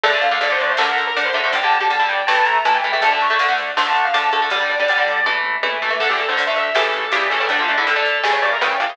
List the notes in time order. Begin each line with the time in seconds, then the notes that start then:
0.03 D2 D3 A3 D5, kick, crash
0.13 D3 A3
0.22 D2 F5, ride
0.31 D3 A3 F5
0.41 D2 D3 A3 D5, ride
0.50 D3 A3 C5
0.60 D2 D5, ride
0.70 C5
0.77 D2 D3 A3 A#4, snare
0.88 A#4
0.98 D2, ride
1.07 A#4
1.15 D2 D3 A3, ride
1.25 C5
1.33 D2 D3 A3 E5, ride
1.44 D3 A3 C5
1.52 G1 D3 G3 G5, kick, ride
1.63 D3 G3 A5
1.71 G1 A5, ride
1.80 D3 G3
1.90 G1 D3 G3, ride
1.99 D3 G3
2.08 G1 G5, kick, ride
2.27 A1 E3 A3 A5, snare
2.45 A1 A#5, ride
2.65 A1 E3 A3 A5, ride
2.74 G5
2.83 A1 E3 A3, ride
2.92 E3 A3 E5
3.01 D2 D3 A3 A5, kick, ride
3.11 D3 A3 A5
3.20 D2 C#6, ride
3.30 D3 A3
3.39 D2 D3 A3, ride
3.49 D3 A3
3.58 D2, ride
3.77 D2 D3 A3 C6, snare
3.86 A5
3.95 D2, ride
4.05 F5
4.14 D2 D3 A3 A5, ride
4.32 D2 D3 A3, ride
4.42 D3 A3
4.50 G1 D3 G3 D5, kick, ride
4.60 D3 G3
4.69 G1 D5, ride
4.80 D3 G3
4.88 G1 D3 G3, ride
4.98 D3 G3
5.07 G1, kick, ride
5.24 A1 E3 A3, kick, high tom
5.44 A1, floor tom
5.63 A1 E3 A3, high tom
5.81 A1 E3 A3, floor tom
5.90 E3 A3
5.99 D2 D3 A3 A4, kick, crash
6.09 D3 A3 G4
6.18 D2 A4, ride
6.28 D3 A3 C5
6.37 D2 D3 A3, ride
6.47 D3 A3 E5
6.56 D2 E5, ride
6.75 A1 C#3 E3 G3 A3 A4, snare
6.93 A1, ride
7.11 A1 C#3 E3 G3 A3 G4, ride
7.30 A1 C#3 E3 G3 A3 A4, ride
7.40 C#3 E3 G3 A3
7.49 D2 D3 A3 D4, kick, ride
7.59 D3 A3 F4
7.68 D2 D4, ride
7.78 D3 A3 E4
7.86 D2 D3 A3 A4, ride
7.96 D3 A3
8.05 D2, kick, ride
8.24 A1 C#3 E3 G3 A3, snare
8.33 C#5
8.42 A1 D5, ride
8.53 A#4
8.61 A1 C#3 E3 G3 A3 G5, ride
8.80 A1 C#3 E3 G3 A3 F5, ride
8.89 C#3 E3 G3 A3